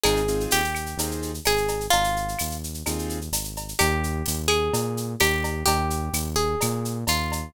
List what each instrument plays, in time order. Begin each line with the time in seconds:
0.04 synth bass 1 G#1, acoustic grand piano C4 D#4 F4 G#4, acoustic guitar (steel) G#4, cowbell, claves, shaker
0.16 shaker
0.28 acoustic grand piano C4 D#4 F4 G#4, shaker
0.40 shaker
0.51 synth bass 1 D#2, acoustic guitar (steel) G4, tambourine, shaker
0.64 shaker
0.75 claves, shaker
0.86 shaker
0.97 synth bass 1 D#2, acoustic grand piano C4 D#4 F4 G#4, cowbell, shaker
1.11 shaker
1.22 shaker
1.34 shaker
1.45 synth bass 1 G#1, acoustic guitar (steel) G#4, tambourine, cowbell, claves, shaker
1.57 shaker
1.68 cowbell, shaker
1.80 shaker
1.90 synth bass 1 G#1, acoustic guitar (steel) F4, cowbell, shaker
2.04 shaker
2.16 shaker
2.28 shaker
2.39 synth bass 1 D#2, tambourine, claves, shaker
2.51 shaker
2.64 shaker
2.74 shaker
2.86 synth bass 1 D#2, acoustic grand piano C4 D#4 F4 G#4, cowbell, claves, shaker
2.99 shaker
3.09 shaker
3.21 shaker
3.32 synth bass 1 G#1, tambourine, cowbell, shaker
3.44 shaker
3.56 cowbell, shaker
3.68 shaker
3.79 synth bass 1 D#2, acoustic guitar (steel) G4, cowbell, claves, shaker
4.04 shaker
4.26 synth bass 1 D#2, tambourine, shaker
4.48 acoustic guitar (steel) G#4, claves, shaker
4.73 synth bass 1 A#2, cowbell, shaker
4.97 shaker
5.20 synth bass 1 D#2, acoustic guitar (steel) G4, tambourine, cowbell, claves, shaker
5.44 cowbell, shaker
5.66 synth bass 1 D#2, acoustic guitar (steel) G4, cowbell, shaker
5.90 shaker
6.13 synth bass 1 D#2, tambourine, claves, shaker
6.36 acoustic guitar (steel) G#4, shaker
6.61 synth bass 1 A#2, cowbell, claves, shaker
6.85 shaker
7.07 synth bass 1 D#2, acoustic guitar (steel) F4, tambourine, cowbell, shaker
7.32 cowbell, shaker